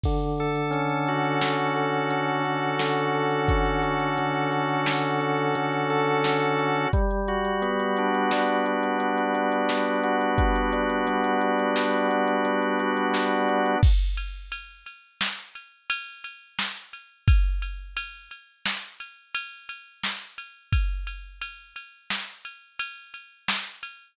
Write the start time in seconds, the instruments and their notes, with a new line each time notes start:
0.03 drawbar organ D3, kick, crash
0.21 closed hi-hat
0.38 drawbar organ A4, closed hi-hat
0.55 closed hi-hat
0.71 drawbar organ C#4, closed hi-hat
0.90 closed hi-hat
1.07 drawbar organ F#4, closed hi-hat
1.24 closed hi-hat
1.41 drawbar organ D3, snare
1.59 closed hi-hat
1.75 drawbar organ A4, closed hi-hat
1.93 closed hi-hat
2.10 drawbar organ F#4, closed hi-hat
2.28 closed hi-hat
2.44 drawbar organ C#4, closed hi-hat
2.62 closed hi-hat
2.79 drawbar organ D3, snare
2.97 closed hi-hat
3.14 drawbar organ A4, closed hi-hat
3.31 closed hi-hat
3.48 drawbar organ C#4, kick, closed hi-hat
3.66 closed hi-hat
3.83 drawbar organ F#4, closed hi-hat
4.00 closed hi-hat
4.17 drawbar organ D3, closed hi-hat
4.34 closed hi-hat
4.52 drawbar organ A4, closed hi-hat
4.69 closed hi-hat
4.86 drawbar organ F#4, snare
5.03 closed hi-hat
5.21 drawbar organ C#4, closed hi-hat
5.38 closed hi-hat
5.55 drawbar organ D3, closed hi-hat
5.72 closed hi-hat
5.90 drawbar organ A4, closed hi-hat
6.07 closed hi-hat
6.24 drawbar organ C#4, snare
6.41 closed hi-hat
6.59 drawbar organ F#4, closed hi-hat
6.76 closed hi-hat
6.93 drawbar organ G3, kick, closed hi-hat
7.10 closed hi-hat
7.28 drawbar organ F#4, closed hi-hat
7.45 closed hi-hat
7.62 drawbar organ B3, closed hi-hat
7.79 closed hi-hat
7.97 drawbar organ D4, closed hi-hat
8.14 closed hi-hat
8.31 drawbar organ G3, snare
8.48 closed hi-hat
8.66 drawbar organ F#4, closed hi-hat
8.83 closed hi-hat
8.98 drawbar organ D4, closed hi-hat
9.17 closed hi-hat
9.34 drawbar organ B3, closed hi-hat
9.52 closed hi-hat
9.69 drawbar organ G3, snare
9.86 closed hi-hat
10.03 drawbar organ F#4, closed hi-hat
10.21 closed hi-hat
10.38 drawbar organ B3, kick, closed hi-hat
10.55 closed hi-hat
10.72 drawbar organ D4, closed hi-hat
10.90 closed hi-hat
11.07 drawbar organ G3, closed hi-hat
11.24 closed hi-hat
11.41 drawbar organ F#4, closed hi-hat
11.59 closed hi-hat
11.76 drawbar organ D4, snare
11.93 closed hi-hat
12.08 drawbar organ B3, closed hi-hat
12.28 closed hi-hat
12.45 drawbar organ G3, closed hi-hat
12.62 closed hi-hat
12.79 drawbar organ F#4, closed hi-hat
12.97 closed hi-hat
13.14 drawbar organ B3, snare
13.31 closed hi-hat
13.48 drawbar organ D4, closed hi-hat
13.66 closed hi-hat
13.83 kick, crash
14.17 ride
14.52 ride
14.86 ride
15.21 snare
15.55 ride
15.90 ride
16.24 ride
16.59 snare
16.93 ride
17.28 kick, ride
17.62 ride
17.97 ride
18.31 ride
18.66 snare
19.00 ride
19.34 ride
19.69 ride
20.03 snare
20.38 ride
20.72 kick, ride
21.07 ride
21.41 ride
21.76 ride
22.10 snare
22.45 ride
22.79 ride
23.14 ride
23.48 snare
23.83 ride